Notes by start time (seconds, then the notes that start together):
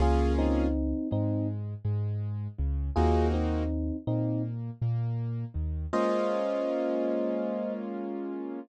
0.00 C#2 A#3 C#4 F4 G#4
0.38 C4 D#4
1.11 G#2 G#3 C4 D#4
1.85 G#2 G#3
2.58 C#2 C#3
2.96 D#2 A#3 C4 D#4 F4 F#4 G#4
3.34 C4 D#4
4.07 A#2 A#3 C4 D#4
4.81 A#2 A#3
5.54 D#2 D#3
5.93 G#3 A#3 C#4 F4 C5 D#5